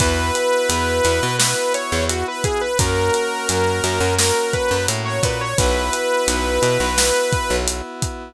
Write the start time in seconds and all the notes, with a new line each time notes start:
0.00 E2 B3 E4 F#4 B4, kick, closed hi-hat
0.35 closed hi-hat
0.69 E2, closed hi-hat
1.05 E2, closed hi-hat
1.23 B2
1.39 B3 E4 F#4 B4, snare
1.74 C#5, closed hi-hat
1.92 E2
2.09 F#4, closed hi-hat
2.28 B4
2.44 G#4, kick, closed hi-hat
2.61 B4
2.79 F#2 A#3 C#4 F#4 A#4, kick, closed hi-hat
3.14 closed hi-hat
3.49 F#2, closed hi-hat
3.84 F#2, closed hi-hat
4.00 F#2
4.19 A#3 C#4 F#4 A#4, snare
4.53 B4, kick, closed hi-hat
4.71 F#2
4.88 A2, closed hi-hat
5.05 C#5
5.23 A#2 B4, kick, closed hi-hat
5.41 C#5
5.58 B1 B3 E4 F#4 B4, kick, closed hi-hat
5.93 closed hi-hat
6.28 B1, closed hi-hat
6.62 B2, closed hi-hat
6.80 B1
6.97 B3 E4 F#4, snare
7.32 kick, closed hi-hat
7.50 B1
7.68 closed hi-hat
8.02 kick, closed hi-hat